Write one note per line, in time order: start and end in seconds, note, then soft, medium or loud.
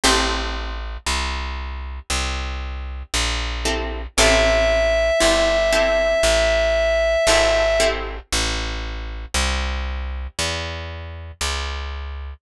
0.03 0.97 A1 loud
0.03 0.76 C4 loud
0.03 0.76 E4 loud
0.03 0.76 G4 loud
0.03 0.76 A4 loud
1.06 2.00 C2 medium
2.10 3.03 C2 medium
3.14 4.07 A#1 medium
3.65 4.01 C4 medium
3.65 4.01 E4 loud
3.65 4.01 G4 medium
3.65 4.01 A4 medium
4.17 5.11 A1 loud
4.17 4.91 C4 loud
4.17 4.91 E4 loud
4.17 4.91 G4 loud
4.17 4.91 A4 loud
4.17 7.88 E5 loud
5.20 6.15 G1 medium
5.20 5.56 C4 medium
5.20 5.56 E4 medium
5.20 5.56 G4 medium
5.20 5.56 A4 medium
5.72 6.45 C4 medium
5.72 6.45 E4 medium
5.72 6.45 G4 medium
5.72 6.45 A4 medium
6.23 7.16 A1 medium
7.27 8.20 G#1 loud
7.27 7.64 C4 medium
7.27 7.64 E4 medium
7.27 7.64 G4 medium
7.27 7.64 A4 loud
7.80 8.16 C4 loud
7.80 8.16 E4 loud
7.80 8.16 G4 loud
7.80 8.16 A4 medium
8.33 9.26 A1 loud
9.34 10.27 C2 medium
10.39 11.32 E2 medium
11.41 12.34 C#2 medium